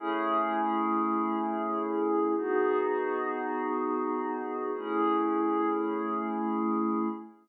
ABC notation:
X:1
M:3/4
L:1/8
Q:1/4=76
K:Alyd
V:1 name="Pad 5 (bowed)"
[A,CEG]6 | [B,DFG]6 | [A,CEG]6 |]